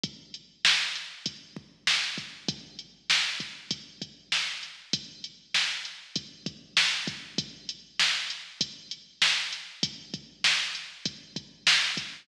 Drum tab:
HH |xx-xx-xx|xx-xxx-x|xx-xxxxx|xx-xxx-x|
SD |--o---o-|--o---o-|--o---o-|--o---o-|
BD |o---oo-o|o--ooo--|o---oo-o|o---o---|

HH |xx-xxx-x|
SD |--o---o-|
BD |oo--oo-o|